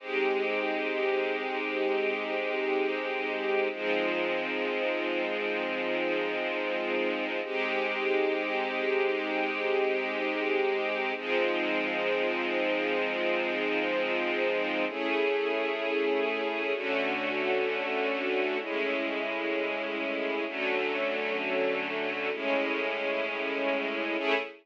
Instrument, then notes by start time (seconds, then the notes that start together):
string ensemble 1
0.00 G#3 C4 D#4 G4
3.72 F3 G#3 C4 D#4
7.44 G#3 C4 D#4 G4
11.16 F3 G#3 C4 D#4
14.89 A3 C#4 E4 G#4
16.74 D3 A3 C#4 F#4
18.61 A2 G#3 C#4 E4
20.46 D3 F#3 A3 C#4
22.33 A2 G#3 C#4 E4
24.19 A3 C#4 E4 G#4